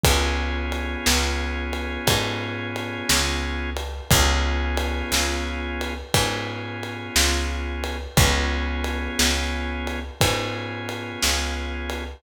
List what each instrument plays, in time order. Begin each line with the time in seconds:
0.04 electric bass (finger) C#2, drawbar organ B3 C#4 F4 G#4, kick, ride
0.72 ride
1.06 electric bass (finger) C#2, snare
1.73 ride
2.07 electric bass (finger) G#2, kick, ride
2.76 ride
3.09 electric bass (finger) C#2, snare
3.77 ride
4.11 electric bass (finger) C#2, drawbar organ B3 C#4 F4 G#4, kick, ride
4.77 ride
5.12 electric bass (finger) C#2, snare
5.81 ride
6.14 electric bass (finger) G#2, drawbar organ B3 C#4 F4 G#4, kick, ride
6.83 ride
7.16 electric bass (finger) C#2, snare
7.84 ride
8.17 electric bass (finger) C#2, drawbar organ B3 C#4 F4 G#4, kick, ride
8.84 ride
9.19 electric bass (finger) C#2, snare
9.87 ride
10.21 electric bass (finger) G#2, drawbar organ B3 C#4 F4 G#4, kick, ride
10.89 ride
11.22 electric bass (finger) C#2, snare
11.90 ride